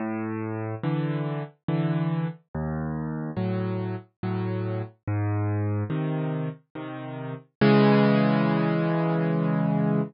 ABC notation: X:1
M:3/4
L:1/8
Q:1/4=71
K:C#m
V:1 name="Acoustic Grand Piano" clef=bass
A,,2 [=D,E,]2 [D,E,]2 | D,,2 [A,,F,]2 [A,,F,]2 | G,,2 [^B,,D,]2 [B,,D,]2 | [C,E,G,]6 |]